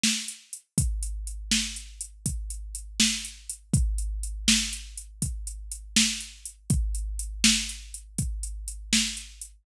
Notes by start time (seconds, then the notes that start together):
0.03 snare
0.28 closed hi-hat
0.53 closed hi-hat
0.78 kick, closed hi-hat
1.03 closed hi-hat
1.27 closed hi-hat
1.51 snare
1.76 closed hi-hat
2.01 closed hi-hat
2.26 kick, closed hi-hat
2.50 closed hi-hat
2.75 closed hi-hat
3.00 snare
3.25 closed hi-hat
3.49 closed hi-hat
3.74 kick, closed hi-hat
3.98 closed hi-hat
4.23 closed hi-hat
4.48 snare
4.73 closed hi-hat
4.97 closed hi-hat
5.22 kick, closed hi-hat
5.47 closed hi-hat
5.72 closed hi-hat
5.96 snare
6.20 closed hi-hat
6.45 closed hi-hat
6.70 kick, closed hi-hat
6.95 closed hi-hat
7.19 closed hi-hat
7.44 snare
7.69 closed hi-hat
7.94 closed hi-hat
8.18 kick, closed hi-hat
8.43 closed hi-hat
8.68 closed hi-hat
8.93 snare
9.17 closed hi-hat
9.41 closed hi-hat